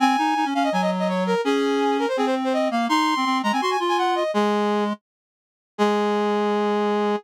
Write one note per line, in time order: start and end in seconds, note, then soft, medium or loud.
0.00 0.16 C4 loud
0.00 0.47 G#5 loud
0.18 0.34 D#4 loud
0.36 0.45 D#4 loud
0.45 0.54 C#4 loud
0.54 0.70 C#4 loud
0.54 0.63 F5 medium
0.64 0.72 D#5 medium
0.72 1.35 F#3 loud
0.72 0.81 G#5 medium
0.82 0.90 D#5 loud
0.99 1.08 D#5 medium
1.09 1.24 C#5 medium
1.27 1.41 A#4 medium
1.44 2.06 C#4 loud
1.44 1.97 G#4 loud
1.99 2.08 A#4 medium
2.08 2.17 C5 medium
2.17 2.69 C4 medium
2.17 2.26 G#4 medium
2.26 2.35 C5 medium
2.44 2.53 C5 medium
2.53 2.68 D#5 medium
2.71 2.88 A#3 medium
2.71 2.86 F5 medium
2.89 3.14 D#4 loud
2.89 3.38 C6 medium
3.16 3.25 C4 medium
3.25 3.42 C4 loud
3.43 3.52 G#3 loud
3.43 3.52 A#5 medium
3.52 3.61 C4 medium
3.52 3.61 G#5 medium
3.61 3.77 F#4 medium
3.61 3.70 C6 medium
3.70 3.79 G#5 medium
3.80 4.23 F4 loud
3.89 3.97 G#5 medium
3.98 4.15 F#5 medium
4.15 4.31 D#5 medium
4.34 4.93 G#3 loud
4.34 4.84 G#4 loud
5.78 7.16 G#3 loud
5.78 7.16 G#4 loud